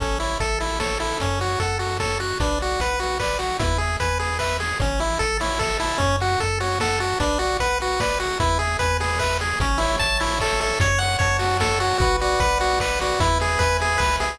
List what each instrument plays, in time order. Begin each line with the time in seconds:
0.00 synth bass 1 A1, lead 1 (square) C#4 A4, kick, closed hi-hat
0.20 lead 1 (square) E4 C#5, open hi-hat
0.40 synth bass 1 A1, lead 1 (square) A4 E5, kick, closed hi-hat
0.60 lead 1 (square) E4 A4, open hi-hat
0.80 lead 1 (square) A4 C#5, kick, snare
1.00 lead 1 (square) E4 A4, open hi-hat
1.20 synth bass 1 F#2, lead 1 (square) C#4, kick, closed hi-hat
1.40 lead 1 (square) F#4 C#5, open hi-hat
1.59 synth bass 1 F#2, lead 1 (square) A4 F#5, kick, closed hi-hat
1.79 lead 1 (square) F#4 A4, open hi-hat
2.00 lead 1 (square) A4 C#5, kick, snare
2.20 lead 1 (square) F#4 F#5, open hi-hat
2.40 synth bass 1 B1, lead 1 (square) D4 B4, kick, closed hi-hat
2.60 lead 1 (square) F#4 D5, open hi-hat
2.79 synth bass 1 B1, lead 1 (square) B4 F#5, kick, closed hi-hat
2.99 lead 1 (square) F#4 B4, open hi-hat
3.20 lead 1 (square) B4 D5, kick, clap
3.39 lead 1 (square) F#4 F#5, open hi-hat
3.59 synth bass 1 E2, lead 1 (square) E4 B4, kick, closed hi-hat
3.78 lead 1 (square) G#4 E5, open hi-hat
4.00 synth bass 1 E2, lead 1 (square) B4 G#5, kick, closed hi-hat
4.19 lead 1 (square) G#4 B4, open hi-hat
4.39 lead 1 (square) B4 E5, kick, clap
4.60 lead 1 (square) G#4 G#5, open hi-hat
4.80 synth bass 1 A1, lead 1 (square) C#4 C#5, kick, closed hi-hat
5.00 lead 1 (square) E4 E5, open hi-hat
5.19 synth bass 1 A1, lead 1 (square) A4 A5, kick, closed hi-hat
5.40 lead 1 (square) E4 C#5, open hi-hat
5.59 lead 1 (square) A4 E5, kick, clap
5.80 lead 1 (square) E4 A5, open hi-hat
5.98 synth bass 1 F#2, lead 1 (square) C#4 C#5, kick, closed hi-hat
6.20 lead 1 (square) F#4 F#5, open hi-hat
6.40 synth bass 1 F#2, lead 1 (square) A4 A5, kick, closed hi-hat
6.60 lead 1 (square) F#4 C#5, open hi-hat
6.80 lead 1 (square) A4 F#5, kick, snare
7.00 lead 1 (square) F#4 A5, open hi-hat
7.20 synth bass 1 B1, lead 1 (square) D4 B4, kick, closed hi-hat
7.39 lead 1 (square) F#4 D5, open hi-hat
7.59 synth bass 1 B1, lead 1 (square) B4 F#5, kick, closed hi-hat
7.80 lead 1 (square) F#4 B4, open hi-hat
8.00 lead 1 (square) B4 D5, kick, snare
8.20 lead 1 (square) F#4 F#5, open hi-hat
8.40 synth bass 1 E2, lead 1 (square) E4 B4, kick, closed hi-hat
8.59 lead 1 (square) G#4 E5, open hi-hat
8.79 synth bass 1 E2, lead 1 (square) B4 G#5, kick, closed hi-hat
9.00 lead 1 (square) G#4 B4, open hi-hat
9.19 lead 1 (square) B4 E5, kick, clap
9.40 lead 1 (square) G#4 G#5, open hi-hat
9.60 synth bass 1 A1, lead 1 (square) C#4 C#5, kick, closed hi-hat
9.78 lead 1 (square) E4 E5, open hi-hat
9.99 synth bass 1 A1, lead 1 (square) A5, kick, closed hi-hat
10.20 lead 1 (square) E4 E5, open hi-hat
10.40 lead 1 (square) A4 C#5, kick, clap
10.60 lead 1 (square) A4 E5, open hi-hat
10.80 synth bass 1 F#2, lead 1 (square) C#5, kick, closed hi-hat
10.99 lead 1 (square) F#5, open hi-hat
11.19 synth bass 1 F#2, lead 1 (square) C#5 A5, kick, closed hi-hat
11.39 lead 1 (square) F#4 F#5, open hi-hat
11.60 lead 1 (square) A4 C#5, kick, snare
11.80 lead 1 (square) F#4 F#5, open hi-hat
11.98 synth bass 1 B1, lead 1 (square) F#4 B4, kick, closed hi-hat
12.20 lead 1 (square) F#4 D5, open hi-hat
12.40 synth bass 1 B1, lead 1 (square) B4 F#5, kick, closed hi-hat
12.60 lead 1 (square) F#4 D5, open hi-hat
12.80 lead 1 (square) B4, kick, clap
13.00 lead 1 (square) F#4 D5, open hi-hat
13.20 synth bass 1 E2, lead 1 (square) E4 B4, kick, closed hi-hat
13.40 lead 1 (square) G#4 E5, open hi-hat
13.59 synth bass 1 E2, lead 1 (square) B4 G#5, kick, closed hi-hat
13.80 lead 1 (square) G#4 E5, open hi-hat
13.98 synth bass 1 C#2, lead 1 (square) B4, kick, clap
14.20 synth bass 1 C2, lead 1 (square) G#4 E5, open hi-hat